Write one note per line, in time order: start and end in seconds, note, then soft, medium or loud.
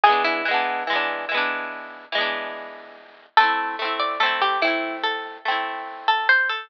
0.03 0.42 E3 loud
0.03 0.42 G#3 loud
0.03 0.23 G#4 loud
0.09 0.42 B3 loud
0.09 0.42 D4 loud
0.24 2.43 E4 loud
0.45 0.84 E3 loud
0.45 0.84 G#3 medium
0.51 0.84 B3 loud
0.51 0.84 D4 loud
0.87 1.25 E3 medium
0.87 1.25 G#3 medium
0.93 1.25 B3 medium
0.93 1.25 D4 medium
1.29 2.05 E3 medium
1.29 2.05 G#3 medium
1.35 2.05 B3 loud
1.35 2.05 D4 medium
2.12 3.27 E3 loud
2.12 3.27 G#3 loud
2.18 3.27 B3 medium
2.18 3.27 D4 medium
3.37 3.76 A3 loud
3.37 3.76 C4 loud
3.37 3.97 A4 loud
3.43 3.76 E4 loud
3.79 4.17 A3 medium
3.79 4.17 C4 medium
3.85 4.17 E4 medium
3.99 4.19 D5 medium
4.20 4.58 A3 loud
4.20 4.58 C4 loud
4.20 4.40 A4 medium
4.26 4.58 E4 loud
4.41 4.61 G4 medium
4.62 5.38 A3 medium
4.62 5.38 C4 medium
4.62 4.97 E4 medium
4.67 5.38 E4 medium
5.03 5.38 A4 medium
5.45 6.60 A3 medium
5.45 6.60 C4 loud
5.51 6.60 E4 medium
6.08 6.28 A4 medium
6.29 6.49 C5 loud
6.49 6.69 A4 medium